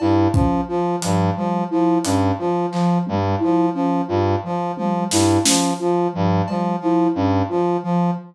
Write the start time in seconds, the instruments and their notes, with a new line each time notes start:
0.00 brass section G2, flute E4, cowbell
0.33 brass section F3, flute C#4, kick
0.68 brass section F3, flute F4
1.01 brass section G2, flute F3, closed hi-hat
1.37 brass section F3, flute G3
1.71 brass section F3, flute E4
2.04 brass section G2, flute C#4, closed hi-hat
2.39 brass section F3, flute F4
2.71 brass section F3, flute F3, clap
3.07 brass section G2, flute G3, high tom
3.39 brass section F3, flute E4
3.74 brass section F3, flute C#4
4.08 brass section G2, flute F4
4.44 flute F3, brass section F3
4.77 brass section F3, flute G3, high tom
5.11 brass section G2, flute E4, snare
5.44 brass section F3, flute C#4, snare
5.79 brass section F3, flute F4
6.13 brass section G2, flute F3
6.48 brass section F3, flute G3, cowbell
6.80 brass section F3, flute E4
7.15 brass section G2, flute C#4
7.49 brass section F3, flute F4
7.83 brass section F3, flute F3